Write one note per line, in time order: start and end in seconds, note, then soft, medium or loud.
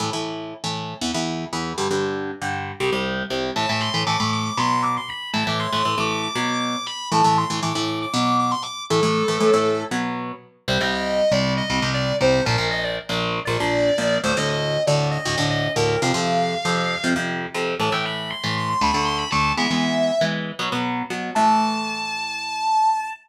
0.00 0.10 A2 medium
0.00 0.10 E3 medium
0.00 0.10 A3 medium
0.13 0.54 A2 medium
0.13 0.54 E3 medium
0.13 0.54 A3 medium
0.64 0.94 A2 medium
0.64 0.94 E3 medium
0.64 0.94 A3 medium
1.01 1.12 E2 medium
1.01 1.12 E3 medium
1.01 1.12 B3 medium
1.14 1.45 E2 medium
1.14 1.45 E3 medium
1.14 1.45 B3 medium
1.53 1.73 E2 medium
1.53 1.73 E3 medium
1.53 1.73 B3 medium
1.78 1.88 G2 loud
1.78 1.88 D3 medium
1.78 1.88 G3 medium
1.91 2.31 G2 medium
1.91 2.31 D3 medium
1.91 2.31 G3 medium
2.42 2.72 G2 medium
2.42 2.72 D3 medium
2.42 2.72 G3 medium
2.80 2.90 C2 medium
2.80 2.90 C3 medium
2.80 2.90 G3 medium
2.92 3.23 C2 medium
2.92 3.23 C3 medium
2.92 3.23 G3 medium
3.30 3.51 C2 medium
3.30 3.51 C3 medium
3.30 3.51 G3 medium
3.56 3.66 A2 loud
3.56 3.66 E3 medium
3.56 3.66 A3 loud
3.56 3.68 A5 medium
3.69 3.90 A2 medium
3.69 3.90 E3 medium
3.69 3.90 A3 medium
3.69 3.81 A5 medium
3.80 4.02 C6 medium
3.94 4.04 A2 medium
3.94 4.04 E3 medium
3.94 4.04 A3 medium
4.07 4.17 A2 medium
4.07 4.17 E3 medium
4.07 4.17 A3 medium
4.07 4.31 D6 medium
4.20 4.50 A2 medium
4.20 4.50 E3 medium
4.20 4.50 A3 medium
4.33 4.44 D6 medium
4.45 4.57 D6 medium
4.57 4.98 B2 loud
4.57 4.98 F#3 medium
4.57 4.98 B3 loud
4.57 4.84 C6 medium
4.82 4.94 D6 medium
4.97 5.09 C6 medium
5.08 5.30 B5 medium
5.33 5.44 A2 loud
5.33 5.44 E3 loud
5.33 5.44 A3 medium
5.33 5.45 A5 medium
5.47 5.67 A2 medium
5.47 5.67 E3 medium
5.47 5.67 A3 medium
5.47 5.60 D6 medium
5.59 5.96 C6 medium
5.73 5.83 A2 medium
5.73 5.83 E3 medium
5.73 5.83 A3 medium
5.85 5.95 A2 medium
5.85 5.95 E3 medium
5.85 5.95 A3 medium
5.98 6.28 A2 medium
5.98 6.28 E3 medium
5.98 6.28 A3 medium
5.98 6.22 D6 medium
6.22 6.60 D6 medium
6.35 6.76 B2 loud
6.35 6.76 F#3 loud
6.35 6.76 B3 loud
6.61 6.85 D6 medium
6.86 7.08 B5 medium
7.12 7.22 A2 loud
7.12 7.22 E3 loud
7.12 7.22 A3 medium
7.12 7.24 A5 medium
7.24 7.45 A2 medium
7.24 7.45 E3 medium
7.24 7.45 A3 medium
7.24 7.36 A5 medium
7.38 7.59 C6 medium
7.50 7.60 A2 medium
7.50 7.60 E3 medium
7.50 7.60 A3 medium
7.63 7.73 A2 medium
7.63 7.73 E3 medium
7.63 7.73 A3 medium
7.63 7.86 D6 medium
7.75 8.06 A2 medium
7.75 8.06 E3 medium
7.75 8.06 A3 medium
7.86 7.98 D6 medium
8.02 8.13 D6 medium
8.14 8.54 B2 loud
8.14 8.54 F#3 loud
8.14 8.54 B3 loud
8.14 8.37 D6 medium
8.39 8.51 D6 medium
8.51 8.63 C6 medium
8.62 8.83 D6 medium
8.90 9.01 A2 loud
8.90 9.01 E3 medium
8.90 9.01 A3 loud
8.90 9.82 A4 medium
9.03 9.23 A2 medium
9.03 9.23 E3 medium
9.03 9.23 A3 medium
9.28 9.38 A2 loud
9.28 9.38 E3 medium
9.28 9.38 A3 medium
9.40 9.51 A2 medium
9.40 9.51 E3 medium
9.40 9.51 A3 medium
9.53 9.84 A2 medium
9.53 9.84 E3 medium
9.53 9.84 A3 medium
9.91 10.32 B2 medium
9.91 10.32 F#3 loud
9.91 10.32 B3 loud
10.68 10.78 C2 loud
10.68 10.78 C3 loud
10.68 10.78 G3 loud
10.68 10.80 C5 medium
10.81 11.21 C2 medium
10.81 11.21 C3 medium
10.81 11.21 G3 loud
10.81 10.93 D#5 medium
10.94 11.31 D#5 medium
11.31 11.62 C2 medium
11.31 11.62 C3 medium
11.31 11.62 G3 medium
11.31 11.53 D5 medium
11.57 11.88 D#5 medium
11.70 11.80 C2 medium
11.70 11.80 C3 medium
11.70 11.80 G3 medium
11.82 12.13 C2 medium
11.82 12.13 C3 medium
11.82 12.13 G3 medium
11.94 12.16 D5 medium
12.21 12.41 C2 medium
12.21 12.41 C3 medium
12.21 12.41 G3 medium
12.21 12.43 C5 medium
12.45 12.56 A#1 loud
12.45 12.56 A#2 loud
12.45 12.56 F3 loud
12.45 12.66 A#4 medium
12.58 12.99 A#1 medium
12.58 12.99 A#2 medium
12.58 12.99 F3 medium
12.71 12.83 D#5 medium
12.83 12.95 D5 medium
13.09 13.40 A#1 loud
13.09 13.40 A#2 medium
13.09 13.40 F3 medium
13.45 13.57 A#1 loud
13.45 13.57 A#2 medium
13.45 13.57 F3 loud
13.45 14.17 D5 medium
13.60 13.91 A#1 medium
13.60 13.91 A#2 medium
13.60 13.91 F3 medium
13.98 14.18 A#1 medium
13.98 14.18 A#2 medium
13.98 14.18 F3 medium
14.24 14.34 D2 loud
14.24 14.34 A2 medium
14.24 14.34 D3 medium
14.24 14.36 C5 medium
14.37 14.78 D2 medium
14.37 14.78 A2 medium
14.37 14.78 D3 loud
14.37 14.49 D#5 medium
14.49 14.82 D#5 medium
14.87 15.18 D2 medium
14.87 15.18 A2 medium
14.87 15.18 D3 medium
14.87 15.07 D5 medium
15.11 15.44 D#5 medium
15.25 15.36 D2 loud
15.25 15.36 A2 medium
15.25 15.36 D3 medium
15.38 15.68 D2 medium
15.38 15.68 A2 medium
15.38 15.68 D3 loud
15.50 15.72 D#5 medium
15.76 15.96 D2 medium
15.76 15.96 A2 medium
15.76 15.96 D3 medium
15.76 16.00 A#4 medium
16.02 16.12 F2 loud
16.02 16.12 C3 loud
16.02 16.12 F3 loud
16.02 17.06 F5 medium
16.14 16.55 F2 medium
16.14 16.55 C3 loud
16.14 16.55 F3 medium
16.65 16.96 F2 medium
16.65 16.96 C3 medium
16.65 16.96 F3 medium
17.04 17.14 F2 medium
17.04 17.14 C3 medium
17.04 17.14 F3 loud
17.16 17.46 F2 medium
17.16 17.46 C3 medium
17.16 17.46 F3 medium
17.54 17.75 F2 medium
17.54 17.75 C3 loud
17.54 17.75 F3 medium
17.80 17.90 A2 loud
17.80 17.90 E3 loud
17.80 17.90 A3 loud
17.80 17.92 A5 medium
17.92 18.33 A2 medium
17.92 18.33 E3 medium
17.92 18.33 A3 medium
17.92 18.04 G5 medium
18.05 18.30 B5 medium
18.30 18.54 C6 medium
18.44 18.74 A2 medium
18.44 18.74 E3 medium
18.44 18.74 A3 medium
18.57 18.69 C6 medium
18.69 18.81 C6 medium
18.81 18.91 D2 loud
18.81 18.91 D3 medium
18.81 18.91 A3 loud
18.81 19.04 B5 medium
18.94 19.25 D2 medium
18.94 19.25 D3 medium
18.94 19.25 A3 medium
19.05 19.17 C6 medium
19.17 19.29 B5 medium
19.31 19.53 D2 medium
19.31 19.53 D3 medium
19.31 19.53 A3 medium
19.31 19.52 A5 medium
19.57 19.68 E3 loud
19.57 19.68 G#3 loud
19.57 19.68 B3 loud
19.57 20.23 E5 medium
19.71 20.11 E3 medium
19.71 20.11 G#3 medium
19.71 20.11 B3 medium
20.21 20.52 E3 medium
20.21 20.52 G#3 medium
20.21 20.52 B3 medium
20.59 20.69 B2 medium
20.59 20.69 F#3 loud
20.59 20.69 B3 loud
20.72 21.03 B2 medium
20.72 21.03 F#3 medium
20.72 21.03 B3 medium
21.10 21.31 B2 medium
21.10 21.31 F#3 medium
21.10 21.31 B3 medium
21.35 23.10 A2 medium
21.35 23.10 E3 loud
21.35 23.10 A3 medium
21.35 23.09 A5 loud